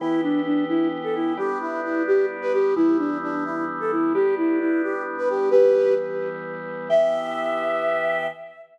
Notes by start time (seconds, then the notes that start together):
0.00 E3 B3 E4 G4
0.23 D4
0.45 D4
0.69 E4
1.04 A4
1.15 E4
1.37 G3 B3 D4 G4
1.61 E4
1.84 E4
2.07 G4
2.42 B4
2.53 G4
2.76 E3 G3 B3 E4
2.98 D4
3.23 D4
3.45 E4
3.80 A4
3.92 E4
4.14 G3 B3 D4 G4
4.37 E4
4.60 E4
4.83 G4
5.18 B4
5.29 G4
5.51 E3 G3 B3 G4 B4
6.89 E3 B3 G4 E5